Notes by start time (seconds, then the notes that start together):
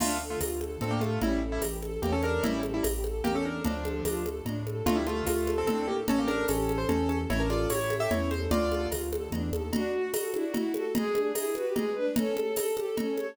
0.00 D2 A3 D4 F4, crash, cowbell, low conga
0.20 A4
0.30 A3 F4
0.41 D2 F4, tambourine, cowbell, high conga
0.61 A4, high conga
0.81 A2 C4 D4 A4, cowbell, low conga
0.91 A#3 G4
1.00 A3 F4 A4, high conga
1.22 A1 G3 C#4 E4, cowbell, low conga
1.42 A4
1.52 G3 E4
1.62 A1 G4, tambourine, cowbell, high conga
1.82 A4, high conga
2.02 E2 A#3 C#4 G4, cowbell, low conga
2.12 C#4 A4
2.23 D4 A4 A#4, high conga
2.43 A1 G3 C#4 E4, cowbell, low conga
2.62 A4, high conga
2.74 G3 E4
2.83 A1 G4, tambourine, cowbell, high conga
3.04 A4, high conga
3.24 E2 A#3 C#4 G4, cowbell, low conga
3.35 C#4 A4
3.45 D4 A4 A#4
3.65 D2 F3 D4, cowbell, low conga
3.84 A4, high conga
4.05 D2 F4, tambourine, cowbell, high conga
4.26 A4, high conga
4.45 A2 D4, cowbell, low conga
4.67 A4, high conga
4.86 D2 A3 D4 F4, cowbell, low conga
4.96 G3 E4
5.07 A3 F4 A4, high conga
5.26 D2 A3 F4, tambourine, cowbell, high conga
5.47 A4, high conga
5.58 C4 A4
5.67 A2 C4 D4 A4, cowbell, low conga
5.88 A#3 G4 A4
6.08 A1 C#4 A4, cowbell, low conga
6.18 A#3 G4
6.27 D4 A4 A#4, high conga
6.48 A1 C#4 G4 A4, tambourine, cowbell, high conga
6.69 A4, high conga
6.78 C5
6.89 E2 C#4 A4, cowbell, low conga
7.09 C#4 A4, high conga
7.29 A1 C#4 E4 C#5, cowbell, low conga
7.40 D4 A#4
7.50 F4 A4 D5, high conga
7.69 A1 E4 G4 C#5, tambourine, cowbell, high conga
7.90 A4, high conga
8.00 G4 E5
8.11 E2 C#4 E4 C#5, cowbell, low conga
8.31 A4 C5, high conga
8.51 D2 D4 F4 D5, cowbell, low conga
8.71 A4, high conga
8.91 D2 F4, tambourine, cowbell, high conga
9.13 A4, high conga
9.32 E2 D4, cowbell, low conga
9.52 D#2 A4, high conga
9.73 D4 F#4, cowbell, low conga
9.94 F#4
10.13 F#4 A4, tambourine, cowbell, high conga
10.33 D4 E4, high conga
10.44 F#4
10.54 E4 F#4, cowbell, low conga
10.74 F#4 A4, high conga
10.95 G#3 G#4, cowbell, low conga
11.14 D4, high conga
11.35 E4 G#4, tambourine, cowbell, high conga
11.54 F#4 B4, high conga
11.65 G4
11.75 G#3 G#4, cowbell, low conga
11.95 D4 B4
12.16 C#4 A4, cowbell, low conga
12.37 A4, high conga
12.56 A4, tambourine, cowbell, high conga
12.77 G4 A4, high conga
12.87 A4
12.97 C#4 A4, cowbell, low conga
13.17 A4 C#5, high conga